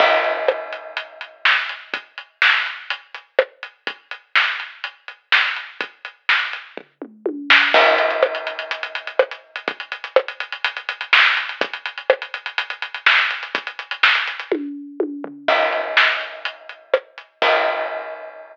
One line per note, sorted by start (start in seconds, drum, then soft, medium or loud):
0.00 kick loud
0.00 crash loud
0.24 closed hi-hat medium
0.48 cross-stick loud
0.73 closed hi-hat medium
0.97 closed hi-hat loud
1.21 closed hi-hat medium
1.45 snare loud
1.69 closed hi-hat medium
1.94 kick medium
1.94 closed hi-hat loud
2.18 closed hi-hat medium
2.42 snare loud
2.66 closed hi-hat medium
2.90 closed hi-hat loud
3.15 closed hi-hat medium
3.39 cross-stick loud
3.63 closed hi-hat medium
3.87 kick loud
3.87 closed hi-hat medium
4.11 closed hi-hat medium
4.35 snare medium
4.60 closed hi-hat medium
4.84 closed hi-hat medium
5.08 closed hi-hat medium
5.32 snare loud
5.56 closed hi-hat medium
5.81 kick loud
5.81 closed hi-hat loud
6.05 closed hi-hat medium
6.29 snare medium
6.53 closed hi-hat medium
6.77 kick medium
6.77 floor tom medium
7.02 mid tom medium
7.26 high tom medium
7.50 snare loud
7.74 kick loud
7.74 crash loud
7.86 closed hi-hat medium
7.98 closed hi-hat medium
8.11 closed hi-hat medium
8.23 cross-stick loud
8.35 closed hi-hat medium
8.47 closed hi-hat medium
8.59 closed hi-hat medium
8.71 closed hi-hat loud
8.83 closed hi-hat medium
8.95 closed hi-hat medium
9.07 closed hi-hat medium
9.19 cross-stick loud
9.31 closed hi-hat medium
9.56 closed hi-hat medium
9.68 kick loud
9.68 closed hi-hat medium
9.80 closed hi-hat medium
9.92 closed hi-hat medium
10.04 closed hi-hat medium
10.16 cross-stick loud
10.28 closed hi-hat medium
10.40 closed hi-hat medium
10.52 closed hi-hat medium
10.64 closed hi-hat loud
10.77 closed hi-hat medium
10.89 closed hi-hat loud
11.01 closed hi-hat medium
11.13 snare loud
11.25 closed hi-hat medium
11.37 closed hi-hat medium
11.49 closed hi-hat medium
11.61 kick loud
11.61 closed hi-hat loud
11.73 closed hi-hat medium
11.86 closed hi-hat medium
11.98 closed hi-hat medium
12.10 cross-stick loud
12.22 closed hi-hat medium
12.34 closed hi-hat medium
12.46 closed hi-hat medium
12.58 closed hi-hat loud
12.70 closed hi-hat medium
12.82 closed hi-hat medium
12.94 closed hi-hat medium
13.06 snare loud
13.19 closed hi-hat medium
13.31 closed hi-hat medium
13.43 closed hi-hat medium
13.55 kick loud
13.55 closed hi-hat loud
13.67 closed hi-hat medium
13.79 closed hi-hat medium
13.91 closed hi-hat medium
14.03 snare loud
14.15 closed hi-hat medium
14.28 closed hi-hat medium
14.40 closed hi-hat medium
14.52 kick loud
14.52 high tom medium
15.00 high tom medium
15.24 floor tom loud
15.48 kick loud
15.48 crash loud
15.72 closed hi-hat medium
15.97 snare loud
16.21 closed hi-hat medium
16.45 closed hi-hat loud
16.69 closed hi-hat medium
16.94 cross-stick loud
17.18 closed hi-hat medium
17.42 kick loud
17.42 crash loud